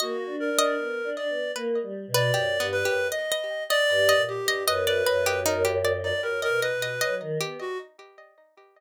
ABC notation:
X:1
M:2/4
L:1/16
Q:1/4=77
K:none
V:1 name="Clarinet"
^F2 ^A4 d2 | z3 d3 B2 | ^d3 =d3 G2 | B B3 ^A z2 d |
^A A B3 z2 ^F |]
V:2 name="Pizzicato Strings"
^d z2 d3 z2 | B3 B (3G2 B,2 G2 | ^d d2 d2 d2 d | ^d =d B G ^D G =d2 |
z ^d d d d2 G2 |]
V:3 name="Choir Aahs"
(3^A,2 D2 D2 (3B,2 D2 B,2 | (3^A,2 G,2 B,,2 (3^F,,2 G,,2 F,,2 | z4 (3G,,2 ^A,,2 G,,2 | ^F,,2 F,,6 |
(3^F,,2 B,,2 B,,2 ^F, ^D, B, z |]